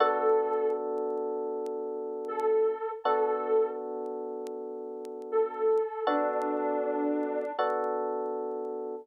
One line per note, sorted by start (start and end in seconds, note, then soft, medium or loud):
0.00 2.74 B3 medium
0.00 2.74 D4 loud
0.00 2.74 F#4 medium
0.00 0.68 A4 loud
0.00 2.74 A4 loud
2.28 2.89 A4 loud
3.04 5.79 B3 medium
3.04 5.79 D4 medium
3.04 5.79 F#4 medium
3.04 3.68 A4 loud
3.04 5.79 A4 medium
5.32 6.03 A4 loud
6.07 7.44 B3 medium
6.07 7.44 D4 medium
6.07 7.51 D4 loud
6.07 7.44 F#4 medium
6.07 7.44 A4 medium
7.59 8.95 B3 medium
7.59 8.95 D4 medium
7.59 8.95 F#4 medium
7.59 8.95 A4 medium